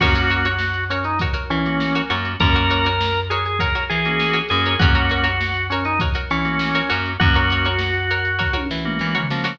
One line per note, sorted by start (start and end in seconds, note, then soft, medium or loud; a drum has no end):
0.00 1.28 F#2 medium
0.00 0.48 A#3 medium
0.00 0.48 C#4 medium
0.00 0.48 F#4 medium
0.00 0.84 F#4 medium
0.00 0.14 F#4 medium
0.00 0.14 A#4 medium
0.00 0.14 C#5 medium
0.00 kick loud
0.00 crash loud
0.15 0.27 F#4 medium
0.15 0.27 A#4 medium
0.15 0.27 C#5 medium
0.15 closed hi-hat medium
0.30 0.42 F#4 medium
0.30 0.42 A#4 medium
0.30 0.42 C#5 medium
0.30 closed hi-hat medium
0.45 0.81 F#4 medium
0.45 0.81 A#4 medium
0.45 0.81 C#5 medium
0.45 closed hi-hat medium
0.58 snare loud
0.74 closed hi-hat medium
0.90 1.04 C#4 medium
0.90 1.15 F#4 medium
0.90 1.15 A#4 medium
0.90 1.15 C#5 medium
0.90 closed hi-hat medium
1.04 1.19 D#4 medium
1.04 closed hi-hat medium
1.19 1.33 F#4 medium
1.19 1.33 A#4 medium
1.19 1.33 C#5 medium
1.19 kick medium
1.19 closed hi-hat loud
1.33 1.81 F#4 medium
1.33 1.81 A#4 medium
1.33 1.81 C#5 medium
1.33 snare soft
1.33 closed hi-hat medium
1.50 2.02 E3 medium
1.50 2.02 C#4 medium
1.50 closed hi-hat medium
1.65 2.02 A#3 medium
1.65 2.02 C#4 medium
1.65 2.02 F#4 medium
1.65 snare medium
1.65 closed hi-hat medium
1.80 snare loud
1.95 2.10 F#4 medium
1.95 2.10 A#4 medium
1.95 2.10 C#5 medium
1.95 closed hi-hat medium
2.10 2.36 F#2 medium
2.10 2.33 A#3 medium
2.10 2.33 C#4 medium
2.10 2.33 F#4 medium
2.10 2.52 F#4 medium
2.10 2.52 A#4 medium
2.10 2.52 C#5 medium
2.10 closed hi-hat medium
2.25 closed hi-hat medium
2.40 3.69 F#2 medium
2.40 2.88 A#3 medium
2.40 2.88 C#4 medium
2.40 2.88 F#4 medium
2.40 3.20 A#4 medium
2.40 kick loud
2.40 closed hi-hat loud
2.54 2.68 F#4 medium
2.54 2.68 A#4 medium
2.54 2.68 C#5 medium
2.54 closed hi-hat medium
2.70 2.82 F#4 medium
2.70 2.82 A#4 medium
2.70 2.82 C#5 medium
2.70 closed hi-hat medium
2.84 3.22 F#4 medium
2.84 3.22 A#4 medium
2.84 3.22 C#5 medium
2.84 closed hi-hat medium
3.01 snare loud
3.15 closed hi-hat medium
3.30 3.55 F#4 medium
3.30 3.44 G#4 medium
3.30 3.55 A#4 medium
3.30 3.55 C#5 medium
3.30 closed hi-hat medium
3.46 3.60 G#4 medium
3.46 closed hi-hat medium
3.59 3.72 F#4 medium
3.59 3.84 A#4 medium
3.59 3.72 A#4 medium
3.59 3.72 C#5 medium
3.59 kick medium
3.59 closed hi-hat loud
3.75 4.23 F#4 medium
3.75 4.23 A#4 medium
3.75 4.23 C#5 medium
3.75 snare soft
3.75 closed hi-hat medium
3.90 4.42 E3 medium
3.90 4.38 G#4 medium
3.90 closed hi-hat medium
4.05 4.42 A#3 medium
4.05 4.42 C#4 medium
4.05 4.42 F#4 medium
4.05 snare medium
4.05 closed hi-hat medium
4.20 snare loud
4.33 4.57 F#4 medium
4.33 4.57 A#4 medium
4.33 4.57 C#5 medium
4.33 closed hi-hat medium
4.49 4.76 F#2 medium
4.49 4.75 A#3 medium
4.49 4.75 C#4 medium
4.49 4.75 F#4 medium
4.49 4.75 G#4 medium
4.49 closed hi-hat medium
4.66 4.78 F#4 medium
4.66 4.78 A#4 medium
4.66 4.78 C#5 medium
4.66 closed hi-hat medium
4.79 6.08 F#2 medium
4.79 5.28 A#3 medium
4.79 5.28 C#4 medium
4.79 5.67 F#4 medium
4.79 5.28 F#4 medium
4.79 4.94 F#4 medium
4.79 4.94 A#4 medium
4.79 4.94 C#5 medium
4.79 kick loud
4.79 closed hi-hat loud
4.95 5.07 F#4 medium
4.95 5.07 A#4 medium
4.95 5.07 C#5 medium
4.95 closed hi-hat medium
5.09 5.23 F#4 medium
5.09 5.23 A#4 medium
5.09 5.23 C#5 medium
5.09 closed hi-hat medium
5.24 5.60 F#4 medium
5.24 5.60 A#4 medium
5.24 5.60 C#5 medium
5.24 closed hi-hat medium
5.41 snare loud
5.54 closed hi-hat medium
5.70 5.84 C#4 medium
5.70 5.96 F#4 medium
5.70 5.96 A#4 medium
5.70 5.96 C#5 medium
5.70 closed hi-hat medium
5.85 5.99 D#4 medium
5.85 closed hi-hat medium
5.99 6.13 F#4 medium
5.99 6.13 A#4 medium
5.99 6.13 C#5 medium
5.99 kick loud
5.99 closed hi-hat loud
6.14 6.63 F#4 medium
6.14 6.63 A#4 medium
6.14 6.63 C#5 medium
6.14 closed hi-hat medium
6.30 6.82 E3 medium
6.30 6.89 C#4 medium
6.30 closed hi-hat medium
6.45 6.81 A#3 medium
6.45 6.81 C#4 medium
6.45 6.81 F#4 medium
6.45 snare medium
6.45 closed hi-hat medium
6.59 snare loud
6.74 6.89 F#4 medium
6.74 6.89 A#4 medium
6.74 6.89 C#5 medium
6.74 snare soft
6.74 closed hi-hat medium
6.89 7.17 F#2 medium
6.89 7.13 A#3 medium
6.89 7.13 C#4 medium
6.89 7.13 F#4 medium
6.89 7.32 F#4 medium
6.89 7.32 A#4 medium
6.89 7.32 C#5 medium
6.89 closed hi-hat medium
7.06 closed hi-hat medium
7.20 8.48 F#2 medium
7.20 7.68 A#3 medium
7.20 7.68 C#4 medium
7.20 8.57 F#4 medium
7.20 7.68 F#4 medium
7.20 kick loud
7.20 closed hi-hat loud
7.34 7.48 F#4 medium
7.34 7.48 A#4 medium
7.34 7.48 C#5 medium
7.34 closed hi-hat medium
7.50 7.64 F#4 medium
7.50 7.64 A#4 medium
7.50 7.64 C#5 medium
7.50 closed hi-hat medium
7.65 8.01 F#4 medium
7.65 8.01 A#4 medium
7.65 8.01 C#5 medium
7.65 closed hi-hat medium
7.79 snare loud
7.94 closed hi-hat medium
8.10 8.35 F#4 medium
8.10 8.35 A#4 medium
8.10 8.35 C#5 medium
8.10 closed hi-hat medium
8.25 closed hi-hat medium
8.39 8.51 F#4 medium
8.39 8.51 A#4 medium
8.39 8.51 C#5 medium
8.39 kick medium
8.39 snare medium
8.53 9.01 F#4 medium
8.53 9.01 A#4 medium
8.53 9.01 C#5 medium
8.53 high tom medium
8.71 8.99 E3 medium
8.71 snare loud
8.85 9.21 A#3 medium
8.85 9.21 C#4 medium
8.85 9.21 F#4 medium
8.85 mid tom medium
8.99 9.28 E3 medium
8.99 snare medium
9.15 9.39 F#4 medium
9.15 9.39 A#4 medium
9.15 9.39 C#5 medium
9.15 floor tom loud
9.30 9.58 F3 medium
9.30 9.54 A#3 medium
9.30 9.54 C#4 medium
9.30 9.54 F#4 medium
9.30 snare loud
9.44 9.56 F#4 medium
9.44 9.56 A#4 medium
9.44 9.56 C#5 medium
9.44 snare loud